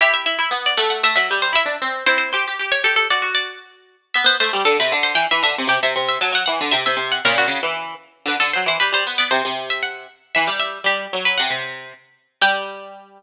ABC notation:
X:1
M:2/2
L:1/8
Q:1/2=116
K:Em
V:1 name="Harpsichord"
e e e3 d f f | e e2 c e3 z | c c c3 ^c A A | d2 d5 z |
e c c2 A B2 c | g e e2 G e2 e | a f f2 e e2 f | ^A F4 z3 |
[K:G] B A c c B c2 d | c2 z e f3 z | e2 e2 G3 B | f5 z3 |
g8 |]
V:2 name="Harpsichord"
[EG]2 E E B,2 A,2 | A, F, G,2 E D C2 | [CE]2 G G G2 G2 | F F6 z |
B, B, A, G, D, C, D,2 | E, E, D, C, C, C, C,2 | F, F, E, D, C, C, C,2 | [^A,,^C,]2 C, E,3 z2 |
[K:G] D, D, F, E, G, G, B, B, | C, C,5 z2 | E, G,3 G,2 F,2 | C, C,4 z3 |
G,8 |]